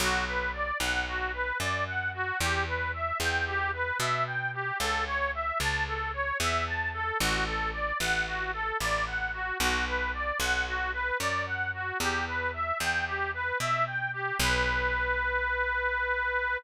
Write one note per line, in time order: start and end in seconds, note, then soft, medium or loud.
0.00 0.72 B1 loud
0.00 0.24 F#4 medium
0.27 0.51 B4 medium
0.53 0.78 D5 medium
0.80 1.52 B1 medium
0.80 1.05 F#5 medium
1.07 1.32 F#4 medium
1.33 1.58 B4 medium
1.60 2.32 F#2 medium
1.60 1.84 D5 medium
1.87 2.12 F#5 medium
2.14 2.38 F#4 medium
2.40 3.12 E2 medium
2.40 2.64 G4 medium
2.67 2.91 B4 medium
2.94 3.18 E5 medium
3.20 3.92 E2 medium
3.20 3.45 G5 medium
3.47 3.71 G4 loud
3.73 3.98 B4 medium
4.00 4.72 B2 medium
4.00 4.24 E5 loud
4.27 4.51 G5 medium
4.54 4.78 G4 medium
4.80 5.52 C#2 medium
4.80 5.04 A4 medium
5.06 5.31 C#5 loud
5.34 5.58 E5 medium
5.60 6.32 C#2 medium
5.60 5.84 A5 medium
5.87 6.11 A4 medium
6.13 6.38 C#5 medium
6.40 7.12 E2 medium
6.40 6.65 E5 medium
6.67 6.91 A5 medium
6.93 7.18 A4 medium
7.20 7.92 A1 loud
7.20 7.44 F#4 medium
7.46 7.71 A4 medium
7.73 7.98 D5 medium
8.00 8.72 A1 medium
8.00 8.25 F#5 loud
8.27 8.51 F#4 medium
8.53 8.77 A4 medium
8.80 9.52 A1 medium
8.80 9.04 D5 loud
9.07 9.31 F#5 medium
9.33 9.58 F#4 medium
9.60 10.32 B1 loud
9.60 9.85 F#4 medium
9.87 10.11 B4 medium
10.14 10.38 D5 medium
10.40 11.12 B1 medium
10.40 10.65 F#5 loud
10.67 10.91 F#4 medium
10.93 11.18 B4 medium
11.20 11.92 F#2 medium
11.20 11.44 D5 medium
11.47 11.71 F#5 medium
11.74 11.98 F#4 medium
12.00 12.72 E2 medium
12.00 12.25 G4 medium
12.27 12.51 B4 medium
12.54 12.78 E5 medium
12.80 13.52 E2 medium
12.80 13.05 G5 medium
13.07 13.31 G4 medium
13.34 13.58 B4 medium
13.60 14.32 B2 medium
13.60 13.85 E5 loud
13.87 14.11 G5 medium
14.13 14.38 G4 medium
14.39 16.57 B1 loud
14.39 16.57 B4 loud